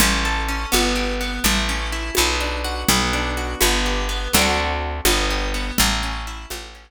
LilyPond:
<<
  \new Staff \with { instrumentName = "Orchestral Harp" } { \time 6/8 \key a \mixolydian \tempo 4. = 83 cis'8 a'8 cis'8 b8 g'8 b8 | a8 cis'8 e'8 b8 d'8 fis'8 | b8 d'8 fis'8 b8 g'8 b8 | <a c' d' fis'>4. b8 g'8 b8 |
a8 cis'8 e'8 a8 cis'8 r8 | }
  \new Staff \with { instrumentName = "Electric Bass (finger)" } { \clef bass \time 6/8 \key a \mixolydian a,,4. g,,4. | a,,4. b,,4. | b,,4. g,,4. | d,4. g,,4. |
a,,4. a,,4. | }
  \new DrumStaff \with { instrumentName = "Drums" } \drummode { \time 6/8 cgl4. cgho4. | cgl4. cgho4. | cgl4. cgho4. | cgl4. cgho4. |
cgl4. cgho4. | }
>>